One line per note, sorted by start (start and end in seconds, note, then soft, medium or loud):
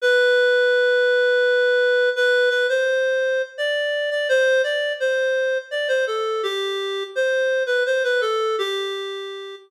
0.01 2.09 B4 medium
2.16 2.49 B4 medium
2.50 2.67 B4 medium
2.69 3.42 C5 medium
3.58 4.10 D5 medium
4.11 4.28 D5 medium
4.29 4.62 C5 medium
4.64 4.93 D5 medium
5.00 5.58 C5 medium
5.71 5.88 D5 medium
5.88 6.05 C5 medium
6.07 6.42 A4 medium
6.43 7.03 G4 medium
7.15 7.63 C5 medium
7.66 7.83 B4 medium
7.86 8.03 C5 medium
8.04 8.21 B4 medium
8.21 8.56 A4 medium
8.58 9.55 G4 medium